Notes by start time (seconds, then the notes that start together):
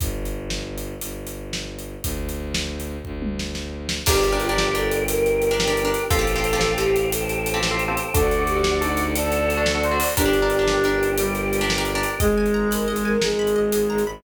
0.00 G1, kick, closed hi-hat
0.25 closed hi-hat
0.50 snare
0.78 closed hi-hat
1.01 G1, closed hi-hat
1.27 closed hi-hat
1.53 snare
1.79 closed hi-hat
2.03 D2, kick, closed hi-hat
2.29 closed hi-hat
2.54 snare
2.80 closed hi-hat
3.05 D2, kick
3.22 high tom
3.39 snare
3.55 snare
3.89 snare
4.06 G1 D4 G4 A#4 D5 G5, kick, crash
4.15 D4 G4 A#4
4.24 closed hi-hat
4.32 D4 G4 A#4
4.40 F4, closed hi-hat
4.49 D4 G4 A#4
4.58 snare
4.75 D4 G4 A4 A#4, closed hi-hat
4.91 closed hi-hat
5.08 G4 A#4 G5, closed hi-hat
5.26 closed hi-hat
5.42 closed hi-hat
5.51 D4 G4 A#4
5.60 snare
5.68 D4 G4 A#4
5.77 closed hi-hat
5.85 D4 G4 A#4
5.94 closed hi-hat
6.10 A1 C4 F4 G4 A4 C5 F5 G5, kick, closed hi-hat
6.19 C4 F4 G4 A4
6.27 closed hi-hat
6.36 C4 F4 G4 A4
6.44 closed hi-hat
6.53 C4 F4 G4 A4
6.61 snare
6.78 C4 F4 G4 A4, closed hi-hat
6.96 closed hi-hat
7.12 A4 C5 G5 A5, closed hi-hat
7.29 closed hi-hat
7.46 closed hi-hat
7.54 C4 F4 G4 A4
7.63 snare
7.71 C4 F4 G4 A4
7.79 closed hi-hat
7.88 C4 F4 G4 A4
7.97 closed hi-hat
8.13 D2 D4 F#4 A4 D5 F#5, kick, closed hi-hat
8.22 D4 F#4 A4
8.31 closed hi-hat
8.39 D4 F#4 A4
8.47 G4, closed hi-hat
8.56 D4 F#4 A4
8.64 snare
8.81 D4 D#4 F#4 A4, closed hi-hat
8.97 closed hi-hat
9.15 A4 D5 F#5 A5, closed hi-hat
9.32 closed hi-hat
9.50 closed hi-hat
9.57 D4 F#4 A4
9.66 snare
9.75 D4 F#4 A4
9.83 C5, closed hi-hat
9.91 D4 F#4 A4
10.00 open hi-hat
10.16 G1 D4 G4 A#4 D5 G5, kick, closed hi-hat
10.25 D4 G4 A#4
10.33 closed hi-hat
10.42 D4 G4 A#4
10.50 closed hi-hat
10.59 D4 G4 A#4
10.68 snare
10.84 D4 G4 A#4, closed hi-hat
11.03 closed hi-hat
11.18 G3 G4 A#4 G5, closed hi-hat
11.35 closed hi-hat
11.53 closed hi-hat
11.61 D4 G4 A#4
11.70 snare
11.78 D4 G4 A#4
11.85 closed hi-hat
11.95 D4 G4 A#4
12.03 closed hi-hat
12.20 G#1 G#3 G#4 D#5, kick, closed hi-hat
12.37 G#1 G#5
12.46 closed hi-hat
12.54 G#1 A#5
12.71 G#1 A#4 B5, closed hi-hat
12.88 G#1 G#4 D#5
12.96 closed hi-hat
13.05 G#1 A#4 G#5
13.22 G#1 G#3 G#4 A#5, snare
13.39 G#1 B5
13.47 closed hi-hat
13.56 G#1 D#5
13.72 G#1 G#5, closed hi-hat
13.90 G#1 A#5
13.98 closed hi-hat
14.07 G#1 B5